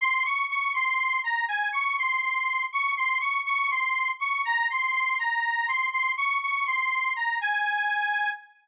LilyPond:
\new Staff { \time 6/8 \key aes \major \tempo 4. = 81 c'''8 des'''8 des'''8 c'''4 bes''8 | aes''8 des'''8 c'''8 c'''4 des'''8 | c'''8 des'''8 des'''8 c'''4 des'''8 | bes''8 c'''8 c'''8 bes''4 c'''8 |
c'''8 des'''8 des'''8 c'''4 bes''8 | aes''2 r4 | }